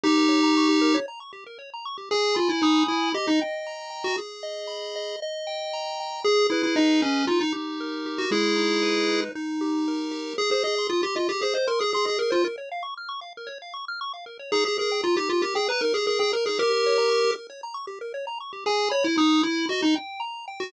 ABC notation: X:1
M:4/4
L:1/16
Q:1/4=116
K:Ab
V:1 name="Lead 1 (square)"
[EG]8 z8 | [K:G#m] G2 =F E D2 E2 =G D z5 ^F | z16 | G2 E E D2 C2 ^E D z5 F |
[EG]8 z8 | [K:Ab] A A A2 F G F G A c B A A A B F | z16 | A A A2 F G F G A _c B A A A B A |
[GB]6 z10 | [K:G#m] G2 c E D2 E2 F D z5 F |]
V:2 name="Lead 1 (square)"
G B d b d' G B d b d' G B d b d' G | [K:G#m] g2 b2 d'2 b2 d2 =g2 a2 g2 | G2 d2 b2 d2 d2 =g2 a2 g2 | G2 B2 d2 B2 D2 =G2 A2 G2 |
G,2 D2 B2 D2 D2 =G2 A2 G2 | [K:Ab] A c e c' e' c' e A c e c' e' c' e A c | B d f d' f' d' f B d f d' f' d' f B d | E G B g b E G B g b E G B g b E |
G B d b d' G B d b d' G B d b d' G | [K:G#m] g2 b2 d'2 b2 d2 =g2 a2 g2 |]